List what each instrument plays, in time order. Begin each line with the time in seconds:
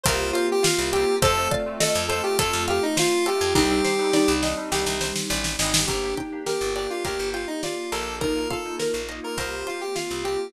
0.03 electric bass (finger) C2, electric piano 2 A#3 C4 F4 G4, string ensemble 1 A#3 C4 F4 G4, pizzicato strings A#4, lead 1 (square) C5, kick, closed hi-hat
0.33 lead 1 (square) F4, pizzicato strings C5, closed hi-hat
0.52 lead 1 (square) G4
0.62 lead 1 (square) F4, pizzicato strings F5, snare
0.78 electric bass (finger) C2
0.92 electric piano 2 A#3 C4 F4 G4, lead 1 (square) G4, pizzicato strings G5, closed hi-hat
1.22 electric bass (finger) F2, electric piano 2 A3 C4 F4, string ensemble 1 A3 C4 F4, pizzicato strings A4, lead 1 (square) A4, xylophone C5, kick, closed hi-hat
1.37 electric piano 2 A3 C4 F4
1.51 xylophone D5, pizzicato strings F5, kick, closed hi-hat
1.66 electric piano 2 A3 C4 F4
1.80 lead 1 (square) A4, pizzicato strings A4, xylophone D#5, snare
1.95 electric bass (finger) F2
2.08 electric piano 2 A3 C4 F4, lead 1 (square) A4, pizzicato strings C5, closed hi-hat
2.23 electric piano 2 A3 C4 F4, lead 1 (square) G4
2.39 electric bass (finger) F2, pizzicato strings A4, lead 1 (square) A4, kick, closed hi-hat
2.53 electric bass (finger) F2
2.68 lead 1 (square) G4, pizzicato strings F5, closed hi-hat
2.83 lead 1 (square) D#4
2.97 lead 1 (square) F4, pizzicato strings C5, snare
3.26 electric piano 2 A3 C4 F4, lead 1 (square) G4, pizzicato strings A4, closed hi-hat
3.41 electric bass (finger) F2
3.55 electric bass (finger) C2, electric piano 2 G3 C4 D4 D#4, string ensemble 1 G3 C4 D4 D#4, xylophone D#4, lead 1 (square) G4, pizzicato strings G4, kick, snare
3.70 electric piano 2 G3 C4 D4 D#4
3.84 pizzicato strings C5, snare
3.99 electric piano 2 G3 C4 D4 D#4
4.13 xylophone D#4, pizzicato strings D5, snare
4.28 electric bass (finger) C2
4.42 electric piano 2 G3 C4 D4 D#4, pizzicato strings D#5, snare
4.57 electric piano 2 G3 C4 D4 D#4
4.72 electric bass (finger) C2, pizzicato strings G4, snare
4.86 electric bass (finger) C2, snare
5.01 pizzicato strings C5, snare
5.16 snare
5.30 electric bass (finger) A1, pizzicato strings D5, snare
5.44 snare
5.59 electric bass (finger) G#1, electric piano 2 G3 C4 D4 D#4, pizzicato strings D#5, snare
5.74 snare
5.87 electric bass (finger) G1, electric piano 2 A#3 D4 G4, string ensemble 1 A#3 D4 G4, xylophone D4, lead 1 (square) G4, pizzicato strings A#4, kick, closed hi-hat
6.03 electric piano 2 A#3 D4 G4
6.17 xylophone D#4, pizzicato strings G5, kick, closed hi-hat
6.32 electric piano 2 A#3 D4 G4
6.46 lead 1 (square) G4, pizzicato strings A#4, xylophone A#4, snare
6.61 electric bass (finger) G1
6.76 electric piano 2 A#3 D4 G4, lead 1 (square) G4, pizzicato strings D5, closed hi-hat
6.90 electric piano 2 A#3 D4 G4, lead 1 (square) F4
7.05 electric bass (finger) D2, lead 1 (square) G4, pizzicato strings A#4, kick, closed hi-hat
7.19 electric bass (finger) G1
7.33 lead 1 (square) F4, pizzicato strings G5, closed hi-hat
7.47 lead 1 (square) D#4
7.63 lead 1 (square) F4, pizzicato strings D5, snare
7.92 electric bass (finger) A#1, electric piano 2 A#3 D4 G4, lead 1 (square) A4, pizzicato strings A#4, closed hi-hat
8.20 string ensemble 1 A#3 D#4 F4, electric piano 2 A#3 D#4 F4, xylophone D#4, lead 1 (square) A#4, pizzicato strings A#4, kick, closed hi-hat
8.36 electric piano 2 A#3 D#4 F4
8.50 xylophone F4, lead 1 (square) A4, pizzicato strings F5, kick, closed hi-hat
8.65 electric piano 2 A#3 D#4 F4
8.79 pizzicato strings A#4, xylophone A#4, snare
8.94 electric bass (finger) A#1
9.09 electric piano 2 A#3 D#4 F4, pizzicato strings D#5, closed hi-hat
9.23 electric piano 2 A#3 D#4 F4, lead 1 (square) A#4
9.37 electric bass (finger) C2, string ensemble 1 A#3 C4 F4 G4, electric piano 2 A#3 C4 F4 G4, pizzicato strings A#4, lead 1 (square) C5, kick, closed hi-hat
9.67 lead 1 (square) F4, pizzicato strings C5, closed hi-hat
9.81 lead 1 (square) G4
9.95 lead 1 (square) F4, pizzicato strings F5, snare
10.11 electric bass (finger) C2
10.24 electric piano 2 A#3 C4 F4 G4, lead 1 (square) G4, pizzicato strings G5, closed hi-hat